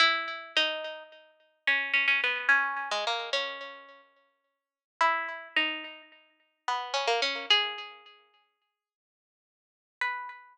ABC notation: X:1
M:9/8
L:1/16
Q:3/8=72
K:B
V:1 name="Pizzicato Strings"
E4 D4 z4 C2 C C B,2 | C3 G, A,2 C6 z6 | E4 D4 z4 B,2 C A, C2 | G8 z10 |
B6 z12 |]